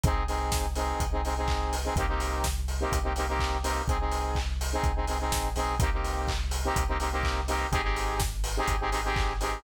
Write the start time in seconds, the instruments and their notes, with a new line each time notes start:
0.04 synth bass 2 C2, lead 2 (sawtooth) C4 D#4 G#4, kick, closed hi-hat
0.28 lead 2 (sawtooth) C4 D#4 G#4, open hi-hat
0.52 kick, snare
0.75 lead 2 (sawtooth) C4 D#4 G#4, open hi-hat
1.00 synth bass 2 C2, kick, closed hi-hat
1.12 lead 2 (sawtooth) C4 D#4 G#4
1.25 lead 2 (sawtooth) C4 D#4 G#4, open hi-hat
1.37 lead 2 (sawtooth) C4 D#4 G#4
1.48 kick, clap
1.73 open hi-hat
1.84 lead 2 (sawtooth) C4 D#4 G#4
1.96 synth bass 2 C2, lead 2 (sawtooth) A#3 C4 D#4 G4, kick, closed hi-hat
2.08 lead 2 (sawtooth) A#3 C4 D#4 G4
2.20 open hi-hat
2.44 kick, snare
2.68 open hi-hat
2.80 lead 2 (sawtooth) A#3 C4 D#4 G4
2.92 synth bass 2 C2, kick, closed hi-hat
3.03 lead 2 (sawtooth) A#3 C4 D#4 G4
3.16 lead 2 (sawtooth) A#3 C4 D#4 G4, open hi-hat
3.29 lead 2 (sawtooth) A#3 C4 D#4 G4
3.39 kick, clap
3.63 lead 2 (sawtooth) A#3 C4 D#4 G4, open hi-hat
3.88 synth bass 2 C2, lead 2 (sawtooth) C4 D#4 G#4, kick, closed hi-hat
4.00 lead 2 (sawtooth) C4 D#4 G#4
4.12 open hi-hat
4.35 kick, clap
4.61 open hi-hat
4.72 lead 2 (sawtooth) C4 D#4 G#4
4.83 synth bass 2 C2, kick, closed hi-hat
4.96 lead 2 (sawtooth) C4 D#4 G#4
5.07 lead 2 (sawtooth) C4 D#4 G#4, open hi-hat
5.20 lead 2 (sawtooth) C4 D#4 G#4
5.32 synth bass 2 A#1, kick, snare
5.56 synth bass 2 B1, lead 2 (sawtooth) C4 D#4 G#4, open hi-hat
5.79 synth bass 2 C2, lead 2 (sawtooth) A#3 C4 D#4 G4, kick, closed hi-hat
5.93 lead 2 (sawtooth) A#3 C4 D#4 G4
6.04 open hi-hat
6.28 kick, clap
6.51 open hi-hat
6.64 lead 2 (sawtooth) A#3 C4 D#4 G4
6.76 synth bass 2 C2, kick, closed hi-hat
6.88 lead 2 (sawtooth) A#3 C4 D#4 G4
7.00 lead 2 (sawtooth) A#3 C4 D#4 G4, open hi-hat
7.12 lead 2 (sawtooth) A#3 C4 D#4 G4
7.23 kick, clap
7.48 lead 2 (sawtooth) A#3 C4 D#4 G4, open hi-hat
7.72 synth bass 2 G#1, lead 2 (sawtooth) C4 D#4 G4 G#4, kick, closed hi-hat
7.83 lead 2 (sawtooth) C4 D#4 G4 G#4
7.96 open hi-hat
8.20 kick, snare
8.44 open hi-hat
8.57 lead 2 (sawtooth) C4 D#4 G4 G#4
8.68 synth bass 2 G#1, kick, closed hi-hat
8.80 lead 2 (sawtooth) C4 D#4 G4 G#4
8.91 lead 2 (sawtooth) C4 D#4 G4 G#4, open hi-hat
9.04 lead 2 (sawtooth) C4 D#4 G4 G#4
9.16 kick, clap
9.40 lead 2 (sawtooth) C4 D#4 G4 G#4, open hi-hat